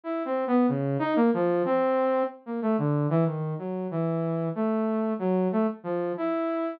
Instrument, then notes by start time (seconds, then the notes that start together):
lead 2 (sawtooth)
0.04 E4
0.25 C4
0.47 B3
0.68 C#3
0.99 D#4
1.16 A#3
1.34 F3
1.65 C4
2.46 A#3
2.62 A3
2.78 D3
3.10 E3
3.25 D#3
3.58 F#3
3.91 E3
4.55 A3
5.19 F#3
5.52 A3
5.83 F3
6.17 E4